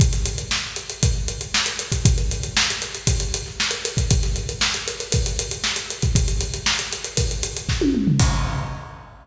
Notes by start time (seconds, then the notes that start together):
0.00 kick, closed hi-hat
0.13 snare, closed hi-hat
0.25 closed hi-hat
0.38 closed hi-hat
0.51 snare
0.76 closed hi-hat
0.90 closed hi-hat
1.03 kick, closed hi-hat
1.28 closed hi-hat
1.41 closed hi-hat
1.54 snare
1.66 closed hi-hat
1.79 closed hi-hat
1.92 kick, closed hi-hat
2.05 kick, closed hi-hat
2.18 closed hi-hat
2.31 closed hi-hat
2.43 closed hi-hat
2.57 snare
2.70 closed hi-hat
2.82 snare, closed hi-hat
2.95 closed hi-hat
3.07 kick, closed hi-hat
3.20 closed hi-hat
3.34 closed hi-hat
3.46 snare
3.60 snare
3.71 closed hi-hat
3.85 closed hi-hat
3.97 kick, closed hi-hat
4.10 kick, closed hi-hat
4.23 snare, closed hi-hat
4.36 closed hi-hat
4.49 closed hi-hat
4.61 snare
4.74 closed hi-hat
4.88 snare, closed hi-hat
5.00 closed hi-hat
5.12 kick, closed hi-hat
5.26 closed hi-hat
5.39 closed hi-hat
5.51 closed hi-hat
5.64 snare
5.76 closed hi-hat
5.90 closed hi-hat
6.02 kick, closed hi-hat
6.15 kick, closed hi-hat
6.28 closed hi-hat
6.40 closed hi-hat
6.54 closed hi-hat
6.66 snare
6.79 closed hi-hat
6.93 closed hi-hat
7.04 closed hi-hat
7.17 kick, closed hi-hat
7.31 closed hi-hat
7.43 closed hi-hat
7.57 closed hi-hat
7.69 kick, snare
7.81 high tom
7.95 mid tom
8.07 floor tom
8.19 kick, crash